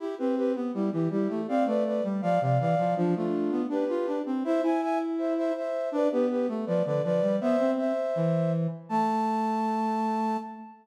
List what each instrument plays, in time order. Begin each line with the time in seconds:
0.00 flute E4 G4, brass section E4
0.18 brass section C4, flute G4 B4
0.37 flute G4 B4
0.55 brass section B3
0.74 brass section G3, flute E4 G4
0.92 brass section E3, flute E4 G4
1.11 brass section G3, flute E4 G4
1.30 brass section A3
1.48 brass section C4, flute D5 F5
1.66 brass section A3, flute B4 D5
1.85 flute B4 D5
2.04 brass section G3
2.22 brass section F3, flute D5 F5
2.41 brass section C3, flute D5 F5
2.60 brass section E3, flute D5 F5
2.78 brass section F3
2.97 brass section F3, flute D4 F4
3.16 brass section A3, flute D4 F4
3.51 brass section B3
3.69 brass section D4, flute G4 B4
3.89 brass section F4
4.07 brass section D4
4.26 brass section C4
4.44 brass section E4, flute C5 E5
4.62 brass section E4, flute E5 G#5
4.82 flute E5 G#5
5.18 flute C5 E5
5.37 flute C5 E5
5.56 flute C5 E5
5.92 brass section D4, flute B4 D5
6.11 brass section B3, flute G4 B4
6.30 flute G4 B4
6.48 brass section A3
6.66 brass section F3, flute B4 D5
6.85 brass section D3, flute B4 D5
7.04 brass section F3, flute B4 D5
7.22 brass section G3
7.41 brass section B3, flute C5 E5
7.59 brass section C4
7.78 flute C5 E5
8.16 brass section E3
8.89 brass section A3, flute A5